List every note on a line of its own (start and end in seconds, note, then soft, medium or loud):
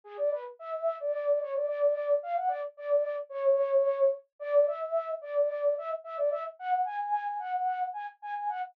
0.04 0.17 G#4 loud
0.17 0.30 D5 loud
0.31 0.44 B4 medium
0.59 0.95 E5 medium
1.00 1.39 D5 medium
1.41 1.54 C#5 medium
1.54 1.66 D5 medium
1.67 2.15 D5 medium
2.23 2.36 F5 loud
2.36 2.49 F#5 loud
2.48 2.61 D5 medium
2.77 3.16 D5 medium
3.29 4.08 C#5 loud
4.39 4.65 D5 loud
4.67 5.12 E5 medium
5.21 5.73 D5 medium
5.78 5.91 E5 loud
6.04 6.17 E5 medium
6.17 6.30 D5 loud
6.31 6.44 E5 loud
6.59 6.82 F#5 loud
6.85 7.37 G#5 medium
7.39 7.86 F#5 medium
7.93 8.06 G#5 medium
8.22 8.34 G#5 medium
8.35 8.48 G#5 medium
8.49 8.62 F#5 medium